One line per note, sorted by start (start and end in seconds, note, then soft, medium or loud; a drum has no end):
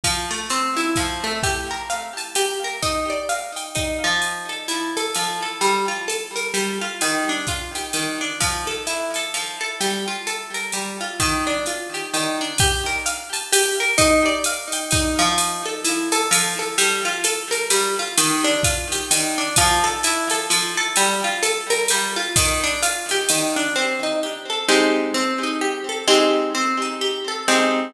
0.04 0.29 F3 medium
0.04 kick medium
0.04 ride loud
0.31 0.48 A3 medium
0.50 0.75 C4 medium
0.50 hi-hat pedal medium
0.50 ride medium
0.77 0.94 E4 medium
0.77 ride medium
0.96 1.22 F3 medium
0.96 kick medium
0.96 ride medium
1.24 1.41 A3 medium
1.43 1.68 G4 medium
1.43 kick medium
1.43 ride medium
1.71 1.88 A#4 medium
1.90 2.14 F5 medium
1.90 hi-hat pedal medium
1.90 ride medium
2.17 2.34 A5 medium
2.17 ride medium
2.35 2.60 G4 medium
2.35 ride loud
2.64 2.81 A#4 medium
2.82 3.07 D#4 medium
2.82 kick medium
2.82 ride medium
3.10 3.27 D5 medium
3.29 3.54 F5 medium
3.29 hi-hat pedal medium
3.29 ride medium
3.56 3.73 G5 medium
3.56 ride medium
3.75 4.00 D#4 medium
3.75 kick medium
3.75 ride medium
4.04 4.48 F3 medium
4.22 ride medium
4.49 4.66 A4 medium
4.68 4.93 E4 medium
4.68 hi-hat pedal medium
4.68 ride medium
4.97 5.14 A4 medium
4.97 ride medium
5.15 5.40 F3 medium
5.15 ride loud
5.42 5.60 A4 medium
5.61 5.86 G3 medium
5.61 ride medium
5.88 6.05 F4 medium
6.08 6.33 A4 medium
6.08 hi-hat pedal medium
6.08 ride medium
6.36 6.53 A#4 medium
6.36 ride medium
6.54 6.78 G3 medium
6.54 ride medium
6.81 6.99 F4 medium
7.01 7.26 D#3 medium
7.01 ride loud
7.29 7.46 D4 medium
7.47 7.73 F4 medium
7.47 kick medium
7.47 hi-hat pedal medium
7.47 ride medium
7.75 7.92 G4 medium
7.75 ride medium
7.93 8.18 D#3 medium
7.93 ride loud
8.21 8.38 D4 medium
8.40 8.65 F3 medium
8.40 kick medium
8.40 ride loud
8.67 8.84 A4 medium
8.87 9.12 E4 medium
8.87 hi-hat pedal medium
8.87 ride medium
9.14 9.33 A4 medium
9.14 ride medium
9.34 9.59 F3 medium
9.34 ride medium
9.61 9.78 A4 medium
9.81 10.05 G3 medium
9.81 ride medium
10.08 10.25 F4 medium
10.27 10.52 A4 medium
10.27 hi-hat pedal medium
10.27 ride medium
10.54 10.71 A#4 medium
10.54 ride medium
10.72 10.98 G3 medium
10.72 ride medium
11.01 11.18 F4 medium
11.20 11.44 D#3 medium
11.20 kick medium
11.20 ride loud
11.47 11.64 D4 medium
11.66 11.92 F4 medium
11.66 hi-hat pedal medium
11.66 ride medium
11.94 12.11 G4 medium
11.94 ride medium
12.14 12.38 D#3 medium
12.14 ride loud
12.41 12.58 D4 medium
12.58 12.85 G4 loud
12.58 kick medium
12.58 ride loud
12.86 13.03 A#4 medium
13.06 13.31 F5 medium
13.06 hi-hat pedal loud
13.06 ride medium
13.33 13.50 A5 medium
13.33 ride medium
13.53 13.77 G4 medium
13.53 ride loud
13.80 13.97 A#4 medium
13.98 14.23 D#4 loud
13.98 kick medium
13.98 ride loud
14.26 14.43 D5 medium
14.44 14.71 F5 medium
14.44 hi-hat pedal loud
14.44 ride loud
14.72 14.90 G5 medium
14.72 ride loud
14.91 15.17 D#4 medium
14.91 kick medium
14.91 ride loud
15.19 15.62 F3 loud
15.38 ride loud
15.66 15.83 A4 medium
15.84 16.09 E4 medium
15.84 hi-hat pedal loud
15.84 ride loud
16.12 16.29 A4 medium
16.12 ride loud
16.31 16.56 F3 medium
16.31 ride loud
16.59 16.76 A4 medium
16.78 17.03 G3 loud
16.78 ride loud
17.05 17.22 F4 medium
17.24 17.49 A4 medium
17.24 hi-hat pedal loud
17.24 ride loud
17.51 17.68 A#4 medium
17.51 ride medium
17.70 17.95 G3 medium
17.70 ride loud
17.99 18.16 F4 medium
18.18 18.42 D#3 medium
18.18 ride loud
18.44 18.61 D4 medium
18.63 18.89 F4 medium
18.63 kick medium
18.63 hi-hat pedal loud
18.63 ride loud
18.92 19.09 G4 medium
18.92 ride loud
19.11 19.35 D#3 medium
19.11 ride loud
19.38 19.55 D4 medium
19.56 19.82 F3 loud
19.56 kick medium
19.56 ride loud
19.84 20.01 A4 medium
20.03 20.29 E4 medium
20.03 hi-hat pedal loud
20.03 ride loud
20.30 20.48 A4 medium
20.30 ride loud
20.50 20.75 F3 medium
20.50 ride loud
20.77 20.95 A4 medium
20.96 21.22 G3 loud
20.96 ride loud
21.24 21.41 F4 medium
21.43 21.67 A4 medium
21.43 hi-hat pedal loud
21.43 ride loud
21.70 21.87 A#4 medium
21.70 ride loud
21.88 22.15 G3 medium
21.88 ride loud
22.16 22.33 F4 medium
22.36 22.61 D#3 loud
22.36 kick medium
22.36 ride loud
22.64 22.81 D4 medium
22.82 23.07 F4 medium
22.82 hi-hat pedal loud
22.82 ride loud
23.09 23.28 G4 medium
23.09 ride medium
23.29 23.54 D#3 medium
23.29 ride loud
23.56 23.73 D4 medium
23.76 24.00 C4 medium
24.03 24.20 D#4 medium
24.23 24.48 G4 medium
24.50 24.67 A4 medium
24.69 25.11 G#3 medium
24.69 25.11 C4 medium
24.69 25.11 D#4 medium
24.69 25.11 G4 medium
25.14 25.39 C4 medium
25.43 25.60 D#4 medium
25.61 25.86 G4 medium
25.89 26.06 A4 medium
26.08 26.50 G#3 medium
26.08 26.50 C4 medium
26.08 26.50 D#4 medium
26.08 26.50 G4 medium
26.55 26.79 C4 medium
26.82 26.99 D#4 medium
27.01 27.26 G4 medium
27.28 27.45 A4 medium
27.48 27.91 G#3 medium
27.48 27.91 C4 medium
27.48 27.91 D#4 medium
27.48 27.91 G4 medium